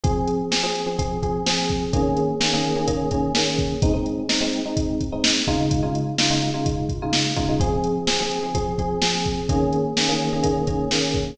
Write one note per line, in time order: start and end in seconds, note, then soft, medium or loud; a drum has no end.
0.04 0.41 F3 medium
0.04 0.41 C4 medium
0.04 0.41 G#4 medium
0.04 kick loud
0.04 closed hi-hat loud
0.28 closed hi-hat medium
0.51 0.61 F3 medium
0.51 0.61 C4 medium
0.51 0.61 G#4 medium
0.51 snare loud
0.63 0.82 F3 medium
0.63 0.82 C4 medium
0.63 0.82 G#4 medium
0.75 closed hi-hat medium
0.86 0.96 F3 medium
0.86 0.96 C4 medium
0.86 0.96 G#4 medium
0.99 1.18 F3 medium
0.99 1.18 C4 medium
0.99 1.18 G#4 medium
0.99 kick medium
0.99 closed hi-hat loud
1.23 1.42 F3 medium
1.23 1.42 C4 medium
1.23 1.42 G#4 medium
1.23 kick medium
1.23 closed hi-hat medium
1.46 1.84 F3 medium
1.46 1.84 C4 medium
1.46 1.84 G#4 medium
1.46 snare loud
1.69 kick medium
1.69 closed hi-hat medium
1.93 2.31 D#3 medium
1.93 2.31 A#3 medium
1.93 2.31 C#4 medium
1.93 2.31 G#4 medium
1.93 kick loud
1.93 closed hi-hat loud
2.17 closed hi-hat medium
2.40 2.50 D#3 medium
2.40 2.50 A#3 medium
2.40 2.50 C#4 medium
2.40 2.50 G#4 medium
2.40 snare loud
2.53 2.72 D#3 medium
2.53 2.72 A#3 medium
2.53 2.72 C#4 medium
2.53 2.72 G#4 medium
2.64 closed hi-hat medium
2.76 2.85 D#3 medium
2.76 2.85 A#3 medium
2.76 2.85 C#4 medium
2.76 2.85 G#4 medium
2.87 3.06 D#3 medium
2.87 3.06 A#3 medium
2.87 3.06 C#4 medium
2.87 3.06 G#4 medium
2.87 kick medium
2.87 closed hi-hat loud
3.11 3.30 D#3 medium
3.11 3.30 A#3 medium
3.11 3.30 C#4 medium
3.11 3.30 G#4 medium
3.11 kick medium
3.11 closed hi-hat medium
3.35 3.73 D#3 medium
3.35 3.73 A#3 medium
3.35 3.73 C#4 medium
3.35 3.73 G#4 medium
3.35 snare loud
3.59 kick medium
3.59 closed hi-hat medium
3.82 3.92 G#3 medium
3.82 3.92 C4 medium
3.82 3.92 D#4 medium
3.82 kick loud
3.82 closed hi-hat loud
3.94 4.22 G#3 medium
3.94 4.22 C4 medium
3.94 4.22 D#4 medium
4.06 closed hi-hat medium
4.29 4.38 G#3 medium
4.29 4.38 C4 medium
4.29 4.38 D#4 medium
4.29 snare loud
4.41 4.60 G#3 medium
4.41 4.60 C4 medium
4.41 4.60 D#4 medium
4.53 closed hi-hat medium
4.65 5.03 G#3 medium
4.65 5.03 C4 medium
4.65 5.03 D#4 medium
4.77 kick loud
4.77 closed hi-hat loud
5.01 kick medium
5.01 closed hi-hat medium
5.12 5.41 G#3 medium
5.12 5.41 C4 medium
5.12 5.41 D#4 medium
5.24 snare loud
5.47 5.81 C#3 medium
5.47 5.81 G#3 medium
5.47 5.81 D#4 medium
5.47 5.81 F4 medium
5.47 kick medium
5.47 closed hi-hat medium
5.71 kick loud
5.71 closed hi-hat loud
5.83 6.11 C#3 medium
5.83 6.11 G#3 medium
5.83 6.11 D#4 medium
5.83 6.11 F4 medium
5.95 closed hi-hat medium
6.18 6.28 C#3 medium
6.18 6.28 G#3 medium
6.18 6.28 D#4 medium
6.18 6.28 F4 medium
6.18 snare loud
6.30 6.49 C#3 medium
6.30 6.49 G#3 medium
6.30 6.49 D#4 medium
6.30 6.49 F4 medium
6.42 closed hi-hat medium
6.54 6.92 C#3 medium
6.54 6.92 G#3 medium
6.54 6.92 D#4 medium
6.54 6.92 F4 medium
6.66 kick medium
6.66 closed hi-hat loud
6.89 kick medium
6.89 closed hi-hat medium
7.02 7.31 C#3 medium
7.02 7.31 G#3 medium
7.02 7.31 D#4 medium
7.02 7.31 F4 medium
7.13 snare loud
7.36 7.46 C#3 medium
7.36 7.46 G#3 medium
7.36 7.46 D#4 medium
7.36 7.46 F4 medium
7.36 kick medium
7.36 closed hi-hat medium
7.49 7.58 C#3 medium
7.49 7.58 G#3 medium
7.49 7.58 D#4 medium
7.49 7.58 F4 medium
7.60 7.98 F3 medium
7.60 7.98 C4 medium
7.60 7.98 G#4 medium
7.60 kick loud
7.60 closed hi-hat loud
7.84 closed hi-hat medium
8.07 8.17 F3 medium
8.07 8.17 C4 medium
8.07 8.17 G#4 medium
8.07 snare loud
8.19 8.38 F3 medium
8.19 8.38 C4 medium
8.19 8.38 G#4 medium
8.31 closed hi-hat medium
8.43 8.53 F3 medium
8.43 8.53 C4 medium
8.43 8.53 G#4 medium
8.55 8.74 F3 medium
8.55 8.74 C4 medium
8.55 8.74 G#4 medium
8.55 kick medium
8.55 closed hi-hat loud
8.78 8.98 F3 medium
8.78 8.98 C4 medium
8.78 8.98 G#4 medium
8.78 kick medium
8.78 closed hi-hat medium
9.02 9.40 F3 medium
9.02 9.40 C4 medium
9.02 9.40 G#4 medium
9.02 snare loud
9.25 kick medium
9.25 closed hi-hat medium
9.49 9.87 D#3 medium
9.49 9.87 A#3 medium
9.49 9.87 C#4 medium
9.49 9.87 G#4 medium
9.49 kick loud
9.49 closed hi-hat loud
9.73 closed hi-hat medium
9.97 10.07 D#3 medium
9.97 10.07 A#3 medium
9.97 10.07 C#4 medium
9.97 10.07 G#4 medium
9.97 snare loud
10.08 10.27 D#3 medium
10.08 10.27 A#3 medium
10.08 10.27 C#4 medium
10.08 10.27 G#4 medium
10.20 closed hi-hat medium
10.33 10.42 D#3 medium
10.33 10.42 A#3 medium
10.33 10.42 C#4 medium
10.33 10.42 G#4 medium
10.43 10.62 D#3 medium
10.43 10.62 A#3 medium
10.43 10.62 C#4 medium
10.43 10.62 G#4 medium
10.43 kick medium
10.43 closed hi-hat loud
10.67 10.86 D#3 medium
10.67 10.86 A#3 medium
10.67 10.86 C#4 medium
10.67 10.86 G#4 medium
10.67 kick medium
10.67 closed hi-hat medium
10.91 11.30 D#3 medium
10.91 11.30 A#3 medium
10.91 11.30 C#4 medium
10.91 11.30 G#4 medium
10.91 snare loud
11.14 kick medium
11.14 closed hi-hat medium